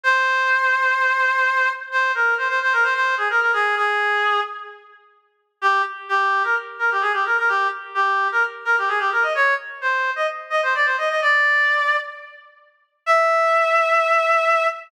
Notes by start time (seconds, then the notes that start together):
0.03 C5
1.92 C5
2.15 A#4
2.38 C5
2.48 C5
2.62 C5
2.73 A#4
2.83 C5
2.94 C5
3.17 G#4
3.30 A#4
3.41 A#4
3.53 G#4
3.77 G#4
5.62 G4
6.09 G4
6.44 A#4
6.79 A#4
6.91 G4
7.01 G#4
7.13 G4
7.26 A#4
7.38 A#4
7.48 G4
7.95 G4
8.32 A#4
8.65 A#4
8.78 G4
8.88 G#4
8.99 G4
9.12 A#4
9.22 D#5
9.35 C#5
9.81 C5
10.16 D#5
10.50 D#5
10.63 C5
10.75 D5
10.85 C5
10.98 D#5
11.09 D#5
11.22 D5
13.06 E5